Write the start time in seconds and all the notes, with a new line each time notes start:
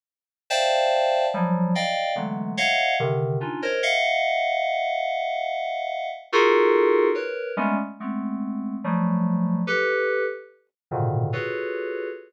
0.50 C5 D5 E5 F5 G5 A5
1.34 F3 F#3 G3
1.75 D5 D#5 F5 G5
2.16 D3 E3 F#3 G#3 A3 B3
2.57 C#5 D#5 E5 F5 F#5
3.00 C3 D3 D#3
3.40 C#4 D4 D#4 F4
3.62 A#4 C5 C#5 D#5
3.83 D#5 E5 F5 F#5
6.32 D#4 F4 F#4 G#4 A4 A#4
7.15 A#4 B4 C#5
7.57 G3 G#3 A3 B3 C#4
8.00 G#3 A3 B3 C4
8.84 F3 F#3 G3 A3
9.67 G4 A4 B4
10.91 G#2 A#2 B2 C#3 D3 D#3
11.33 F4 F#4 G#4 A4 B4 C#5